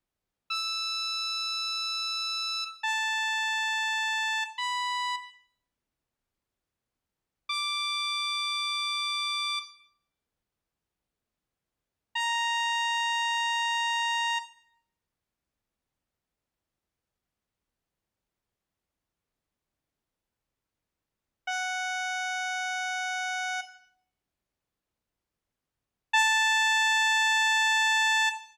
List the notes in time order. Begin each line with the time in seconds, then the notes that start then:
0.50 E6
2.83 A5
4.58 B5
7.49 D6
12.15 A#5
21.47 F#5
26.13 A5